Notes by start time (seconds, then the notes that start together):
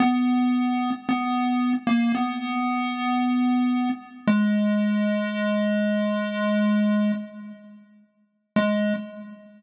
0.00 B3
1.09 B3
1.87 A#3
2.15 B3
4.27 G#3
8.56 G#3